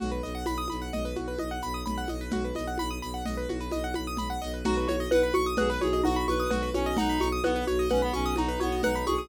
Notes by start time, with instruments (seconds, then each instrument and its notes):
0.00 violin B1, acoustic grand piano F#4, low conga, shaker
0.11 acoustic grand piano B4
0.23 violin B1, acoustic grand piano D#5, shaker
0.35 acoustic grand piano F#5
0.46 violin B1, acoustic grand piano B5, high conga, shaker
0.58 acoustic grand piano D#6
0.68 violin B1, acoustic grand piano B5, high conga, shaker
0.82 acoustic grand piano F#5
0.92 violin B1, acoustic grand piano D#5, low conga, shaker
1.05 acoustic grand piano B4
1.16 violin B1, acoustic grand piano F#4, high conga, shaker
1.28 acoustic grand piano B4
1.38 violin B1, acoustic grand piano D#5, high conga
1.51 acoustic grand piano F#5
1.62 violin B1, acoustic grand piano B5, shaker
1.74 acoustic grand piano D#6
1.85 violin B1, acoustic grand piano B5, low conga, shaker
1.98 acoustic grand piano F#5
2.08 violin B1, acoustic grand piano D#5, high conga, shaker
2.21 acoustic grand piano B4
2.31 violin B1, acoustic grand piano F#4, low conga, shaker
2.44 acoustic grand piano B4
2.55 violin B1, acoustic grand piano D#5, high conga, shaker
2.67 acoustic grand piano F#5
2.78 violin B1, acoustic grand piano B5, high conga, shaker
2.91 acoustic grand piano D#6
3.02 violin B1, acoustic grand piano B5, shaker
3.14 acoustic grand piano F#5
3.25 violin B1, acoustic grand piano D#5, low conga, shaker
3.37 acoustic grand piano B4
3.49 violin B1, acoustic grand piano F#4, high conga, shaker
3.61 acoustic grand piano B4
3.71 violin B1, acoustic grand piano D#5, high conga, shaker
3.84 acoustic grand piano F#5
3.94 violin B1, acoustic grand piano B5, high conga, shaker
4.07 acoustic grand piano D#6
4.17 violin B1, acoustic grand piano B5, low conga, shaker
4.30 acoustic grand piano F#5
4.42 violin B1, acoustic grand piano D#5, shaker
4.54 acoustic grand piano B4
4.64 violin B1, xylophone D#4, clarinet F#4, acoustic grand piano F#4, low conga, shaker
4.77 acoustic grand piano B4
4.87 violin B1, xylophone F#4, acoustic grand piano C#5, high conga, shaker
5.00 acoustic grand piano D#5
5.10 violin B1, xylophone B4, clarinet B4, acoustic grand piano F#5, high conga, shaker
5.23 acoustic grand piano B5
5.33 violin B1, xylophone F#4, acoustic grand piano C#6, high conga, shaker
5.46 acoustic grand piano D#6
5.57 violin B1, acoustic grand piano F#4, clarinet G#4, xylophone B4, low conga, shaker
5.70 acoustic grand piano B4, clarinet B4
5.81 violin B1, xylophone F#4, clarinet G#4, acoustic grand piano C#5, high conga, shaker
5.93 acoustic grand piano D#5
6.04 violin B1, xylophone D#4, clarinet F#4, acoustic grand piano F#5, high conga, shaker
6.16 acoustic grand piano B5
6.27 violin B1, xylophone F#4, clarinet B4, acoustic grand piano C#6, high conga, shaker
6.40 acoustic grand piano D#6
6.50 violin B1, clarinet F#4, acoustic grand piano F#4, xylophone B4, low conga, shaker
6.62 acoustic grand piano B4
6.74 violin B1, clarinet C#4, xylophone F#4, acoustic grand piano C#5, high conga, shaker
6.86 acoustic grand piano D#5
6.97 violin B1, xylophone D#4, clarinet D#4, acoustic grand piano F#5, low conga, shaker
7.09 acoustic grand piano B5
7.19 violin B1, xylophone F#4, acoustic grand piano C#6, high conga, shaker
7.32 acoustic grand piano D#6
7.43 violin B1, clarinet B3, acoustic grand piano F#4, xylophone B4, high conga, shaker
7.56 acoustic grand piano B4
7.67 violin B1, xylophone F#4, acoustic grand piano C#5, shaker
7.79 acoustic grand piano D#5
7.89 violin B1, clarinet C#4, xylophone B4, acoustic grand piano F#5, low conga, shaker
8.02 clarinet B3, acoustic grand piano B5
8.13 violin B1, clarinet C#4, xylophone F#4, acoustic grand piano C#6, shaker
8.26 acoustic grand piano D#6
8.36 violin B1, clarinet D#4, xylophone D#4, acoustic grand piano F#4, high conga, shaker
8.48 acoustic grand piano B4
8.60 violin B1, clarinet B3, xylophone F#4, acoustic grand piano C#5, high conga, shaker
8.72 acoustic grand piano D#5
8.83 violin B1, clarinet D#4, xylophone B4, acoustic grand piano F#5, low conga, shaker
8.95 acoustic grand piano B5
9.06 violin B1, xylophone F#4, clarinet G#4, acoustic grand piano C#6, high conga, shaker
9.18 acoustic grand piano D#6